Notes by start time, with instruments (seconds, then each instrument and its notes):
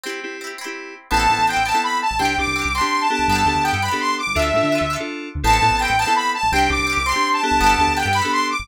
0.03 acoustic guitar (steel) C4 E4, electric piano 2 C4 E4 G4
0.09 acoustic guitar (steel) G4
0.23 electric piano 2 C4 E4 G4
0.41 acoustic guitar (steel) C4 E4
0.47 acoustic guitar (steel) G4
0.58 acoustic guitar (steel) C4 E4
0.64 electric piano 2 C4 E4 G4, acoustic guitar (steel) G4
1.11 synth bass 1 A1, acoustic guitar (steel) B3 C4, electric piano 2 B3 C4 E4 A4, lead 2 (sawtooth) A5
1.17 acoustic guitar (steel) E4 A4
1.30 synth bass 1 A2, electric piano 2 B3 C4 E4 A4
1.39 synth bass 1 A1
1.47 acoustic guitar (steel) B3 C4, lead 2 (sawtooth) G5
1.53 synth bass 1 A1, acoustic guitar (steel) E4 A4
1.66 acoustic guitar (steel) B3 C4, lead 2 (sawtooth) A5
1.71 electric piano 2 B3 C4 E4 A4, acoustic guitar (steel) E4 A4
1.83 lead 2 (sawtooth) B5
2.02 lead 2 (sawtooth) A5
2.11 synth bass 1 A1
2.19 synth bass 1 C2, electric piano 2 C4 D4 G4, acoustic guitar (steel) C4 D4, lead 2 (sawtooth) G5
2.25 acoustic guitar (steel) G4
2.38 synth bass 1 C2, electric piano 2 C4 D4 G4, lead 2 (sawtooth) D6
2.47 synth bass 1 C2
2.56 acoustic guitar (steel) C4 D4
2.62 synth bass 1 C2, acoustic guitar (steel) G4
2.74 acoustic guitar (steel) C4 D4, lead 2 (sawtooth) C6
2.81 electric piano 2 C4 D4 G4, acoustic guitar (steel) G4
3.01 lead 2 (sawtooth) A5
3.10 electric piano 2 B3 D4 G4 A4, lead 2 (sawtooth) A5
3.19 synth bass 1 C2
3.28 synth bass 1 G1, acoustic guitar (steel) B3, lead 2 (sawtooth) A5
3.32 acoustic guitar (steel) D4 G4
3.38 acoustic guitar (steel) A4
3.46 synth bass 1 D2, electric piano 2 B3 D4 G4 A4
3.55 synth bass 1 D2
3.63 acoustic guitar (steel) B3, lead 2 (sawtooth) G5
3.68 acoustic guitar (steel) D4 G4
3.73 synth bass 1 G2, acoustic guitar (steel) A4
3.82 acoustic guitar (steel) B3 D4, lead 2 (sawtooth) B5
3.88 electric piano 2 B3 D4 G4 A4, acoustic guitar (steel) G4 A4
4.00 lead 2 (sawtooth) C6
4.18 lead 2 (sawtooth) D6
4.27 synth bass 1 G1
4.35 synth bass 1 D2, electric piano 2 D4 F4 A4, acoustic guitar (steel) D4, lead 2 (sawtooth) E5
4.39 acoustic guitar (steel) F4 A4
4.54 synth bass 1 A2, electric piano 2 D4 F4 A4
4.63 synth bass 1 D3
4.72 acoustic guitar (steel) D4 F4
4.78 synth bass 1 D2, acoustic guitar (steel) A4
4.90 acoustic guitar (steel) D4 F4
4.96 electric piano 2 D4 F4 A4, acoustic guitar (steel) A4
5.35 synth bass 1 D2
5.43 synth bass 1 A1, electric piano 2 B3 C4 E4 A4, acoustic guitar (steel) B3 C4, lead 2 (sawtooth) A5
5.50 acoustic guitar (steel) E4 A4
5.62 synth bass 1 A2, electric piano 2 B3 C4 E4 A4
5.71 synth bass 1 A1
5.79 acoustic guitar (steel) B3 C4, lead 2 (sawtooth) G5
5.85 acoustic guitar (steel) E4 A4
5.89 synth bass 1 A1
5.98 acoustic guitar (steel) B3 C4, lead 2 (sawtooth) A5
6.05 electric piano 2 B3 C4 E4 A4, acoustic guitar (steel) E4 A4
6.16 lead 2 (sawtooth) B5
6.34 lead 2 (sawtooth) A5
6.43 synth bass 1 A1
6.52 synth bass 1 C2, acoustic guitar (steel) C4 D4, electric piano 2 C4 D4 G4, lead 2 (sawtooth) G5
6.59 acoustic guitar (steel) G4
6.69 synth bass 1 C2, electric piano 2 C4 D4 G4, lead 2 (sawtooth) D6
6.79 synth bass 1 C2
6.87 acoustic guitar (steel) C4 D4
6.93 acoustic guitar (steel) G4
6.97 synth bass 1 C2
7.06 acoustic guitar (steel) C4 D4, lead 2 (sawtooth) C6
7.12 electric piano 2 C4 D4 G4, acoustic guitar (steel) G4
7.33 lead 2 (sawtooth) A5
7.42 electric piano 2 B3 D4 G4 A4, lead 2 (sawtooth) A5
7.51 synth bass 1 C2
7.60 synth bass 1 G1, acoustic guitar (steel) B3 D4, lead 2 (sawtooth) A5
7.67 acoustic guitar (steel) G4 A4
7.78 synth bass 1 D2, electric piano 2 B3 D4 G4 A4
7.87 synth bass 1 D2
7.96 acoustic guitar (steel) B3 D4, lead 2 (sawtooth) G5
8.03 synth bass 1 G2, acoustic guitar (steel) G4 A4
8.13 acoustic guitar (steel) B3 D4, lead 2 (sawtooth) B5
8.19 acoustic guitar (steel) G4 A4
8.24 electric piano 2 B3 D4 G4 A4
8.32 lead 2 (sawtooth) C6
8.51 lead 2 (sawtooth) D6
8.59 synth bass 1 G1